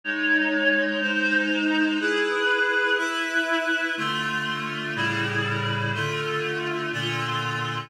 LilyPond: \new Staff { \time 6/8 \key cis \minor \tempo 4. = 61 <gis dis' cis''>4. <gis dis' bis'>4. | <e' gis' b'>4. <e' b' e''>4. | \key d \minor <d a f'>4. <a, cis g e'>4. | <d a f'>4. <bes, d f'>4. | }